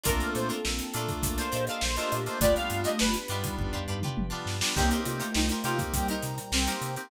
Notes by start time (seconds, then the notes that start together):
0.03 A#1 A3 A#3 C4 D4 F4 A4 A#4, kick, closed hi-hat
0.20 closed hi-hat
0.35 A#2 C5, closed hi-hat
0.49 D4 F4 A4 A#4, closed hi-hat
0.65 A#1 D4 F4 A4 A#4, snare
0.78 snare, closed hi-hat
0.94 A#2 A3 A#3 D4 F4 A4, closed hi-hat
0.98 A#4
1.08 kick, closed hi-hat
1.23 A#1 A#3 D4 A4 A#4, kick, closed hi-hat
1.37 D4 F4 A4 A#4 C5, snare, closed hi-hat
1.52 A#2 D4 F4 G4 A4 A#4 D#5, closed hi-hat
1.67 D4 F4 A4 A#4 F5, closed hi-hat
1.81 A#1 C5, snare
1.96 A3 A#3 D4 F4 G4 A4 A#4 C5 D#5, snare, closed hi-hat
2.11 A#2 G4 D#5, closed hi-hat
2.26 A3 A#3 D4 F4 C5, closed hi-hat
2.39 G1 G3 A3 B3 D4 F4 G4 D5, kick, closed hi-hat
2.44 B4
2.55 F5, closed hi-hat
2.70 G2, closed hi-hat
2.84 D4 F4 G4 B4 D#5, closed hi-hat
2.99 G1 D4 F4 G4 B4, snare
3.14 closed hi-hat
3.28 G2 G3 B3 D4 D#4 F4 G4 B4, closed hi-hat
3.44 kick, closed hi-hat
3.58 G1 B3 D4 G4 B4, kick, floor tom
3.73 D4 F4 G4 B4, floor tom
3.87 G2 D4 F4 G4 B4
4.02 D4 F4 G4 B4, mid tom
4.17 G1, high tom
4.30 G3 B3 D4 F4 G4 B4
4.46 G2, snare
4.61 G3 B3 D4 F4, snare
4.75 C2 A#3 C4 D#4 G4 A#4 C5 D#5 G5, kick, crash
4.79 A#4 C5
4.91 D#4 G4 A#4 C5, closed hi-hat
5.05 C3 A3 F4, closed hi-hat
5.20 D#4 G4 A#4 C5, closed hi-hat
5.34 C2 D#4 G4 A#4 C5, snare
5.49 D#4 G4 A#4 C5, snare, closed hi-hat
5.64 C3 A#3 C4 D#4 F4 G4 A#4 C5, closed hi-hat
5.79 kick, closed hi-hat
5.94 C2 A#2 G3 G4 A#4 C5 G5 A#5, kick, closed hi-hat
6.08 D#4 G4 A#4 C5, closed hi-hat
6.22 C3, snare, closed hi-hat
6.38 closed hi-hat
6.52 C2 C4 D#4 G4 A#4 C5, snare
6.67 A#3 C4 D#4 G4 A#4 C5, closed hi-hat
6.81 C3, closed hi-hat
6.96 A#3 C4 D#4 G4, closed hi-hat